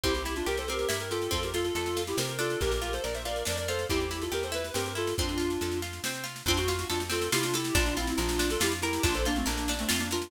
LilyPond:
<<
  \new Staff \with { instrumentName = "Clarinet" } { \time 3/4 \key f \major \tempo 4 = 140 <e' g'>16 <e' g'>8 <d' f'>16 <g' bes'>16 <a' c''>16 <g' bes'>8 <g' bes'>16 <g' bes'>16 <f' a'>8 | <f' a'>16 <g' bes'>16 <f' a'>16 <f' a'>16 <f' a'>8. <e' g'>16 <g' bes'>16 <g' bes'>16 <f' a'>8 | <g' bes'>16 <g' bes'>8 <a' c''>16 <bes' d''>16 <c'' e''>16 <bes' d''>8 <bes' d''>16 <bes' d''>16 <a' c''>8 | <e' g'>16 <e' g'>8 <f' a'>16 <g' bes'>16 <a' c''>16 ces''8 <g' bes'>16 <g' bes'>16 <f' a'>8 |
<d' f'>4. r4. | <d' f'>16 ges'8 ges'16 <d' f'>16 r16 <f' a'>8 <e' g'>16 <d' f'>16 <e' g'>8 | <d' f'>16 <d' f'>16 <c' e'>16 <c' e'>16 <d' f'>8. <f' a'>16 <e' g'>16 r16 <e' g'>8 | <d' f'>16 <a' c''>16 <bes d'>16 <a c'>16 <bes d'>8. <a c'>16 <a c'>16 <bes d'>16 <d' f'>8 | }
  \new Staff \with { instrumentName = "Orchestral Harp" } { \time 3/4 \key f \major c'8 e'8 g'8 c'8 e'8 g'8 | c'8 f'8 a'8 f'8 c'8 d'8~ | d'8 f'8 bes'8 f'8 d'8 f'8 | c'8 e'8 g'8 e'8 c'8 e'8 |
c'8 f'8 a'8 f'8 c'8 f'8 | c'8 f'8 a'8 c'8 f'8 a'8 | d'8 f'8 bes'8 d'8 f'8 bes'8 | d'8 f'8 bes'8 d'8 f'8 bes'8 | }
  \new Staff \with { instrumentName = "Electric Bass (finger)" } { \clef bass \time 3/4 \key f \major c,4 c,4 g,4 | f,4 f,4 c4 | bes,,4 bes,,4 f,4 | e,4 e,4 g,4 |
f,4 f,4 c4 | f,4 f,4 c4 | bes,,4 bes,,4 f,4 | bes,,4 bes,,4 f,4 | }
  \new DrumStaff \with { instrumentName = "Drums" } \drummode { \time 3/4 <bd sn>16 sn16 sn16 sn16 sn16 sn16 sn16 sn16 sn16 sn16 sn16 sn16 | <bd sn>16 sn16 sn16 sn16 sn16 sn16 sn16 sn16 sn16 sn16 sn16 sn16 | <bd sn>16 sn16 sn16 sn16 sn16 sn16 sn16 sn16 sn16 sn16 sn16 sn16 | <bd sn>16 sn16 sn16 sn16 sn16 sn16 sn16 sn16 sn16 sn16 sn16 sn16 |
<bd sn>16 sn16 sn16 sn16 sn16 sn16 sn16 sn16 sn16 sn16 sn16 sn16 | <bd sn>16 sn16 sn16 sn16 sn16 sn16 sn16 sn16 sn16 sn16 sn16 sn16 | <bd sn>16 sn16 sn16 sn16 sn16 sn16 sn16 sn16 sn16 sn16 sn16 sn16 | <bd sn>16 sn16 sn16 sn16 sn16 sn16 sn16 sn16 sn16 sn16 sn16 sn16 | }
>>